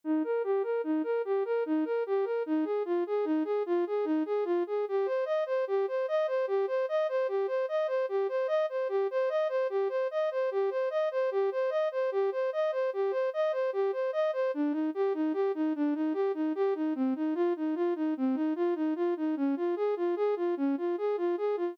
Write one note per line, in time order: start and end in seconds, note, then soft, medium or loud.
0.04 0.23 D#4 medium
0.24 0.42 A#4 medium
0.44 0.63 G4 medium
0.63 0.82 A#4 medium
0.84 1.02 D#4 medium
1.04 1.22 A#4 medium
1.25 1.43 G4 medium
1.45 1.64 A#4 medium
1.66 1.84 D#4 medium
1.85 2.03 A#4 medium
2.06 2.25 G4 medium
2.24 2.43 A#4 medium
2.46 2.65 D#4 medium
2.65 2.83 G#4 medium
2.85 3.04 F4 medium
3.07 3.25 G#4 medium
3.25 3.43 D#4 medium
3.44 3.63 G#4 medium
3.66 3.85 F4 medium
3.87 4.05 G#4 medium
4.05 4.23 D#4 medium
4.26 4.44 G#4 medium
4.45 4.63 F4 medium
4.67 4.85 G#4 medium
4.88 5.07 G4 medium
5.06 5.24 C5 medium
5.25 5.44 D#5 medium
5.46 5.65 C5 medium
5.67 5.86 G4 medium
5.88 6.06 C5 medium
6.08 6.27 D#5 medium
6.27 6.46 C5 medium
6.47 6.66 G4 medium
6.67 6.86 C5 medium
6.89 7.07 D#5 medium
7.09 7.27 C5 medium
7.28 7.47 G4 medium
7.47 7.66 C5 medium
7.68 7.87 D#5 medium
7.87 8.06 C5 medium
8.09 8.27 G4 medium
8.29 8.47 C5 medium
8.48 8.66 D#5 medium
8.69 8.88 C5 medium
8.89 9.07 G4 medium
9.11 9.29 C5 medium
9.29 9.48 D#5 medium
9.49 9.67 C5 medium
9.70 9.88 G4 medium
9.89 10.08 C5 medium
10.11 10.30 D#5 medium
10.31 10.50 C5 medium
10.51 10.70 G4 medium
10.70 10.89 C5 medium
10.90 11.09 D#5 medium
11.11 11.30 C5 medium
11.31 11.50 G4 medium
11.52 11.70 C5 medium
11.70 11.89 D#5 medium
11.92 12.10 C5 medium
12.12 12.30 G4 medium
12.32 12.50 C5 medium
12.53 12.71 D#5 medium
12.72 12.90 C5 medium
12.93 13.12 G4 medium
13.11 13.30 C5 medium
13.33 13.52 D#5 medium
13.52 13.71 C5 medium
13.73 13.91 G4 medium
13.92 14.11 C5 medium
14.13 14.31 D#5 medium
14.33 14.51 C5 medium
14.54 14.73 D4 medium
14.72 14.90 D#4 medium
14.94 15.13 G4 medium
15.14 15.33 D#4 medium
15.33 15.52 G4 medium
15.55 15.73 D#4 medium
15.76 15.94 D4 medium
15.94 16.13 D#4 medium
16.14 16.32 G4 medium
16.34 16.53 D#4 medium
16.55 16.74 G4 medium
16.75 16.94 D#4 medium
16.95 17.14 C4 medium
17.16 17.34 D#4 medium
17.35 17.53 F4 loud
17.56 17.75 D#4 medium
17.75 17.94 F4 medium
17.96 18.14 D#4 medium
18.17 18.36 C4 medium
18.35 18.54 D#4 medium
18.56 18.74 F4 medium
18.75 18.94 D#4 medium
18.96 19.14 F4 medium
19.17 19.35 D#4 medium
19.37 19.55 C#4 medium
19.56 19.75 F4 medium
19.76 19.95 G#4 medium
19.96 20.15 F4 medium
20.16 20.35 G#4 medium
20.36 20.55 F4 medium
20.57 20.76 C#4 medium
20.77 20.96 F4 medium
20.98 21.16 G#4 medium
21.17 21.36 F4 medium
21.37 21.56 G#4 medium
21.57 21.75 F4 medium